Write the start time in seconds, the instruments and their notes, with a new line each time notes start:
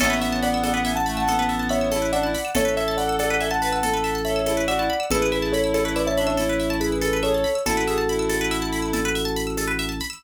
0.00 drawbar organ A1, clarinet B3, pizzicato strings A4, acoustic grand piano C#5 E5, crash, cowbell, low conga, shaker
0.10 pizzicato strings B4
0.21 acoustic grand piano C#5 E5, pizzicato strings E5, shaker
0.32 pizzicato strings A5
0.43 acoustic grand piano D5 F#5, pizzicato strings B5, shaker
0.54 pizzicato strings E6
0.63 pizzicato strings A4, acoustic grand piano D5 F#5, cowbell, high conga, shaker
0.74 pizzicato strings B4, acoustic grand piano D5 F#5
0.85 pizzicato strings E5, acoustic grand piano E5 G#5, shaker
0.96 acoustic grand piano F#5 A5, pizzicato strings A5
1.06 clarinet A3, acoustic grand piano F#5 A5, pizzicato strings B5, shaker
1.17 acoustic grand piano F#5 A5, pizzicato strings E6
1.27 clarinet B3, pizzicato strings A4, cowbell, low conga, shaker
1.39 pizzicato strings B4
1.49 pizzicato strings E5, shaker
1.59 pizzicato strings A5
1.69 acoustic grand piano C#5 E5, pizzicato strings B5, shaker
1.81 pizzicato strings E6
1.91 clarinet E4, pizzicato strings A4, cowbell, high conga, shaker
2.02 pizzicato strings B4
2.12 clarinet D4, acoustic grand piano D5 F#5, pizzicato strings E5, shaker
2.23 clarinet E4, pizzicato strings A5
2.34 pizzicato strings B5, shaker
2.45 pizzicato strings E6
2.55 drawbar organ A1, clarinet A4, pizzicato strings A4, acoustic grand piano C#5 E5, cowbell, low conga, shaker
2.65 pizzicato strings B4
2.77 acoustic grand piano C#5 E5, pizzicato strings E5, shaker
2.88 pizzicato strings A5
2.97 acoustic grand piano D5 F#5, pizzicato strings B5, shaker
3.09 pizzicato strings E6
3.19 pizzicato strings A4, acoustic grand piano D5 F#5, cowbell, high conga, shaker
3.30 pizzicato strings B4, acoustic grand piano D5 F#5
3.40 pizzicato strings E5, acoustic grand piano E5 G#5, shaker
3.51 acoustic grand piano F#5 A5, pizzicato strings A5
3.62 clarinet B4, acoustic grand piano F#5 A5, pizzicato strings B5, shaker
3.72 acoustic grand piano F#5 A5, pizzicato strings E6
3.83 pizzicato strings A4, clarinet A4, cowbell, low conga, shaker
3.94 pizzicato strings B4
4.04 pizzicato strings E5, shaker
4.15 pizzicato strings A5
4.25 acoustic grand piano C#5 E5, pizzicato strings B5, shaker
4.36 pizzicato strings E6
4.46 clarinet E4, pizzicato strings A4, cowbell, high conga, shaker
4.57 pizzicato strings B4
4.68 clarinet F#4, acoustic grand piano D5 F#5, pizzicato strings E5, shaker
4.79 clarinet E4, pizzicato strings A5
4.90 pizzicato strings B5
5.00 pizzicato strings E6
5.10 drawbar organ A1, clarinet E4, acoustic grand piano G#4 B4, pizzicato strings A4, cowbell, low conga, shaker
5.22 pizzicato strings B4
5.32 acoustic grand piano G#4 B4, pizzicato strings E5, shaker
5.42 pizzicato strings A5
5.52 acoustic grand piano A4 C#5, pizzicato strings B5, shaker
5.64 pizzicato strings E6
5.74 pizzicato strings A4, acoustic grand piano A4 C#5, cowbell, high conga, shaker
5.85 acoustic grand piano A4 C#5, pizzicato strings B4
5.96 acoustic grand piano B4 D5, pizzicato strings E5, shaker
6.07 acoustic grand piano C#5 E5, pizzicato strings A5
6.17 clarinet D4, acoustic grand piano C#5 E5, pizzicato strings B5, shaker
6.27 acoustic grand piano C#5 E5, pizzicato strings E6
6.37 clarinet E4, pizzicato strings A4, cowbell, low conga, shaker
6.49 pizzicato strings B4
6.60 pizzicato strings E5, shaker
6.70 pizzicato strings A5
6.80 acoustic grand piano G#4 B4, pizzicato strings B5, shaker
6.92 pizzicato strings E6
7.01 pizzicato strings A4, clarinet A4, cowbell, high conga, shaker
7.13 pizzicato strings B4
7.23 clarinet G#4, acoustic grand piano A4 C#5, pizzicato strings E5, shaker
7.34 clarinet A4, pizzicato strings A5
7.44 pizzicato strings B5, shaker
7.55 pizzicato strings E6
7.65 drawbar organ A1, clarinet E4, acoustic grand piano F#4 A4, pizzicato strings A4, cowbell, low conga, shaker
7.77 pizzicato strings B4
7.87 clarinet G#4, pizzicato strings E5, shaker
7.98 pizzicato strings A5
8.09 clarinet E4, pizzicato strings B5, shaker
8.19 pizzicato strings E6
8.29 pizzicato strings A4, cowbell, high conga, shaker
8.41 pizzicato strings B4
8.51 pizzicato strings E5, shaker
8.62 pizzicato strings A5
8.72 pizzicato strings B5, shaker
8.82 pizzicato strings E6
8.93 pizzicato strings A4, cowbell, low conga, shaker
9.05 pizzicato strings B4
9.15 pizzicato strings E5, shaker
9.25 pizzicato strings A5
9.36 pizzicato strings B5, shaker
9.47 pizzicato strings E6
9.57 pizzicato strings A4, cowbell, high conga, shaker
9.68 pizzicato strings B4
9.79 pizzicato strings E5, shaker
9.89 pizzicato strings A5
10.00 pizzicato strings B5, shaker
10.10 pizzicato strings E6